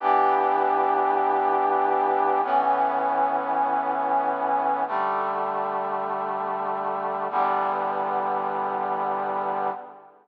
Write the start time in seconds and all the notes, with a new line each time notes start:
0.00 E3 B3 D4 G4
2.43 A2 E3 B3 C#4
4.87 D3 G3 A3
7.30 E2 D3 G3 B3